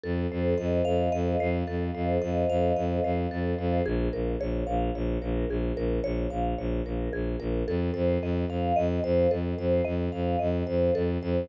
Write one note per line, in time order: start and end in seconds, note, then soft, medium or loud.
0.03 0.27 F2 medium
0.03 1.67 A4 loud
0.31 0.54 F2 medium
0.31 1.40 C5 medium
0.58 0.82 F2 medium
0.58 1.12 D#5 medium
0.85 1.09 F2 medium
0.85 2.49 F5 medium
1.12 1.36 F2 medium
1.12 2.21 D#5 loud
1.40 1.63 F2 medium
1.40 1.94 C5 loud
1.67 1.91 F2 medium
1.67 3.31 A4 medium
1.95 2.18 F2 medium
1.95 3.04 C5 medium
2.22 2.45 F2 medium
2.22 2.76 D#5 medium
2.49 2.72 F2 medium
2.49 3.79 F5 medium
2.76 3.00 F2 medium
2.76 3.80 D#5 medium
3.04 3.27 F2 medium
3.04 3.58 C5 medium
3.31 3.54 F2 medium
3.31 3.83 A4 loud
3.58 3.81 F2 medium
3.58 3.84 C5 medium
3.86 4.09 A#1 medium
3.86 4.13 G#4 loud
4.13 4.36 A#1 medium
4.13 4.40 A#4 medium
4.40 4.64 A#1 medium
4.40 4.68 C#5 medium
4.67 4.91 A#1 medium
4.67 4.94 F5 medium
4.95 5.18 A#1 medium
4.95 5.23 C#5 medium
5.22 5.45 A#1 medium
5.22 5.49 A#4 medium
5.49 5.72 A#1 medium
5.49 5.78 G#4 medium
5.76 6.00 A#1 medium
5.76 6.04 A#4 loud
6.04 6.27 A#1 medium
6.04 6.31 C#5 loud
6.30 6.54 A#1 medium
6.30 6.58 F5 medium
6.58 6.81 A#1 medium
6.58 6.86 C#5 medium
6.85 7.09 A#1 medium
6.85 7.13 A#4 medium
7.13 7.36 A#1 medium
7.13 7.40 G#4 loud
7.40 7.63 A#1 medium
7.40 7.65 A#4 loud
7.67 7.91 F2 medium
7.67 7.95 A4 loud
7.94 8.18 F2 medium
7.94 8.21 C5 medium
8.22 8.45 F2 medium
8.22 8.50 D#5 medium
8.49 8.72 F2 medium
8.49 8.77 F5 loud
8.76 9.00 F2 medium
8.76 9.03 D#5 loud
9.04 9.27 F2 medium
9.04 9.31 C5 loud
9.31 9.54 F2 medium
9.31 9.58 A4 medium
9.58 9.81 F2 medium
9.58 9.86 C5 medium
9.85 10.09 F2 medium
9.85 10.12 D#5 loud
10.12 10.36 F2 medium
10.12 10.39 F5 medium
10.39 10.63 F2 medium
10.39 10.66 D#5 medium
10.67 10.90 F2 medium
10.67 10.94 C5 medium
10.95 11.18 F2 medium
10.95 11.22 A4 loud
11.22 11.45 F2 medium
11.22 11.49 C5 medium